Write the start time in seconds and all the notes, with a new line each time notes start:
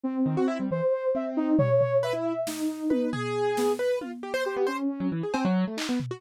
0.03 C4
0.26 D#3
0.37 F#4
0.48 E4
0.60 G3
0.71 E3 C5
1.15 C4 E5
1.37 D#4
1.59 G3 C#5, floor tom
1.81 floor tom
2.03 B4 E5
2.13 E4
2.47 D#4, snare
2.90 B4, high tom
3.13 G#4, floor tom
3.57 B3, snare
3.79 B4
4.01 F4, high tom
4.23 G4
4.34 C5
4.45 G4 C5
4.56 B3
4.67 C#4 C5
5.00 F#3
5.12 E3
5.23 G#4
5.34 C4, cowbell
5.45 F#3
5.67 A3
5.77 D#4, clap
5.89 B3
6.00 floor tom
6.11 F#4